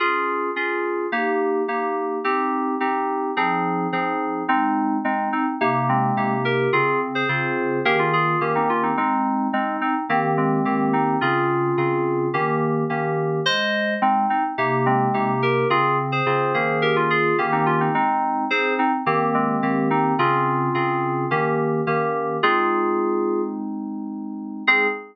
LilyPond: <<
  \new Staff \with { instrumentName = "Electric Piano 2" } { \time 4/4 \key aes \major \tempo 4 = 107 r1 | r1 | <c' ees'>4 <aes c'>8 <c' ees'>16 r8. <aes c'>4 <g' bes'>8 | <f' aes'>8 r16 <aes' c''>4~ <aes' c''>16 <g' bes'>16 <des' f'>16 <f' aes'>8 r16 <c' ees'>16 <des' f'>16 <c' ees'>16 |
<c' ees'>4 <aes c'>8 <c' ees'>16 r8. <aes c'>4 <c' ees'>8 | <des' f'>2 r2 | <c'' ees''>4 <aes c'>8 <c' ees'>16 r8. <aes c'>4 <g' bes'>8 | <f' aes'>8 r16 <aes' c''>4~ <aes' c''>16 <g' bes'>16 <des' f'>16 <f' aes'>8 r16 <c' ees'>16 <des' f'>16 <c' ees'>16 |
<c' ees'>4 <aes' c''>8 <c' ees'>16 r8. <aes c'>4 <c' ees'>8 | <des' f'>2 r2 | <f' aes'>2 r2 | aes'4 r2. | }
  \new Staff \with { instrumentName = "Electric Piano 2" } { \time 4/4 \key aes \major <des' f' aes'>4 <des' f' aes'>4 <bes ees' g'>4 <bes ees' g'>4 | <c' ees' g'>4 <c' ees' g'>4 <f c' ees' aes'>4 <f c' ees' aes'>4 | aes4 <c' ees'>4 <c bes ees' g'>4 <c bes ees' g'>4 | <des c'>4 <des c' f' aes'>4 <ees bes des' aes'>4 <ees bes des' g'>4 |
aes4 <c' ees'>4 <ees bes c' g'>4 <ees bes c' g'>4 | <des c' aes'>4 <des c' f' aes'>4 <ees bes des' g'>4 <ees bes des' g'>4 | aes4 <c' ees'>4 <c bes ees' g'>4 <c bes ees' g'>4 | <des c'>4 <des c' f' aes'>8 <ees bes des' aes'>4. <ees bes des' g'>4 |
aes4 <c' ees'>4 <ees bes c' g'>4 <ees bes c' g'>4 | <des c' aes'>4 <des c' f' aes'>4 <ees bes des' g'>4 <ees bes des' g'>4 | <aes c' ees'>1 | <aes c' ees'>4 r2. | }
>>